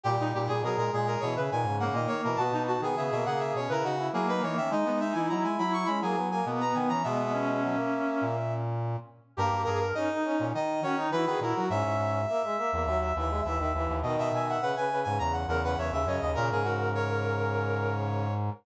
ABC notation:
X:1
M:4/4
L:1/16
Q:1/4=103
K:G#m
V:1 name="Brass Section"
=G2 G ^G A A G A c e g2 f d c A | =a2 a g e e f e c ^A F2 G B c e | d2 e g a g b c' b g2 g z a g a | e12 z4 |
A2 A2 d4 d2 c2 B B A2 | e14 z2 | z e g f f g2 g a f f f e e d2 | A G F2 c10 z2 |]
V:2 name="Brass Section"
=G D G ^G G2 G3 B z2 A,4 | F D F G G2 G3 B z2 A,4 | D B, D E E2 E3 G z2 B,4 | B, B, C8 z6 |
=G2 ^G A D4 z2 C D E G E F | e4 e e e2 e e e2 e4 | d2 e e B4 z2 A B c e c d | A12 z4 |]
V:3 name="Brass Section"
=G,3 G, F, ^G, G,2 E, C, D, C, C, D, D, E, | B,3 B, B, A, A,2 C E D E E D D C | D3 D D E E2 C A, B, A, A, B, B, C | G,4 F, A,5 z6 |
A,4 C D C C D2 F D F F F2 | C4 A, G, A, A, F,2 E, G, E, D, E,2 | D,4 C, C, C, C, C,2 C, C, C, C, C,2 | C, C, C,12 z2 |]
V:4 name="Brass Section" clef=bass
A,, A,, A,, A,, B,, A,, A,,2 B,, C, A,, G,,2 A,, z B,, | B,, B,,2 D, C, B,, C,2 B,, C, C,2 F,2 E, D, | G, G,2 E, F, G, F,2 G, F, F,2 B,,2 D, E, | B,,6 z2 A,,6 z2 |
=G,, G,, G,,2 z3 A,, D,2 D,2 E, D, A,, F, | G,, G,, G,,2 z3 E,, D,,2 D,,2 D,, D,, D,, D,, | B,, B,, B,,2 z3 G,, E,,2 E,,2 E,, D,, F,, D,, | A,, G,,15 |]